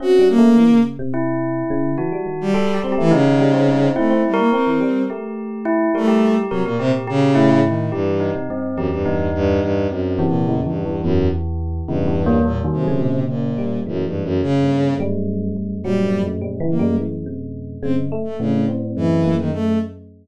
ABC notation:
X:1
M:7/8
L:1/16
Q:1/4=106
K:none
V:1 name="Violin"
_G2 _B,4 z8 | z3 G,3 G, E, _D,6 | A,2 G, _B, C4 z6 | A,3 z _G, _B,, C, z _D,4 _E,2 |
G,,3 z3 _G,, =G,,3 G,,2 G,,2 | (3_G,,4 _B,,4 =G,,4 _G,,2 z4 | G,,4 _B,, z C,4 B,,4 | (3_G,,2 =G,,2 _G,,2 _D,4 z6 |
G,3 z3 _B,2 z6 | C z2 A, _D,2 z2 E,3 _E, A,2 |]
V:2 name="Tubular Bells"
_D4 z4 E6 | _G4 (3A2 =G2 G2 _E6 | (3E4 _B4 B4 G4 E2 | _B G3 B B G2 G2 E2 z2 |
G2 _E2 C2 G2 E6 | C2 E,2 (3_D,2 E,2 E,2 E,6 | (3_D,2 E,2 _B,2 (3G,2 _E,2 _G,2 _B,,6 | (3_G,,4 G,,4 =G,,4 _G,,4 G,,2 |
(3_B,,2 G,,2 _G,,2 (3B,,2 _D,2 G,,2 G,,6 | _G,, G,, z2 A,,4 G,,6 |]
V:3 name="Electric Piano 1"
(3C2 G,2 A,2 E, _D,2 C,5 D,2 | E, G, _E,2 G,2 C A, _D, E, G, C G, C | C C z2 C E, G,2 A,6 | G,4 C, _B,,5 A,,4 |
E,3 C, G,,2 E,,2 E,,4 E,,2 | z2 C,2 (3E,,2 E,,2 E,,2 E,,6 | E,, E,,5 G,, _D,5 G,2 | E,4 _D,2 z2 G,6 |
_G,4 (3=G,2 E,2 G,2 E,2 C,4 | _D,2 A,4 C4 _B,2 z2 |]